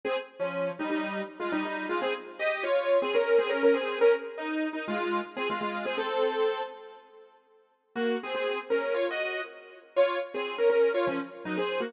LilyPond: \new Staff { \time 4/4 \key bes \dorian \tempo 4 = 121 <c' aes'>16 r8 <f des'>8. <g ees'>16 <g ees'>8. r16 <aes f'>16 <g ees'>16 <g ees'>8 <aes f'>16 | <c' aes'>16 r8 <g' ees''>8 <f' des''>8. <c' aes'>16 <des' bes'>8 <c' aes'>16 <des' bes'>16 <des' bes'>16 <c' aes'>8 | <des' bes'>16 r8 ees'8. ees'16 <aes f'>8. r16 <c' aes'>16 <aes f'>16 <aes f'>8 <c' aes'>16 | <c' a'>4. r2 r8 |
\key ees \dorian <bes ges'>8 <c' aes'>16 <c' aes'>8 r16 <des' bes'>8 <f' des''>16 <ges' ees''>8. r4 | <f' des''>8 r16 <c' aes'>8 <des' bes'>16 <des' bes'>8 <f' des''>16 <f des'>16 r8 <ges ees'>16 <c' aes'>8 <bes ges'>16 | }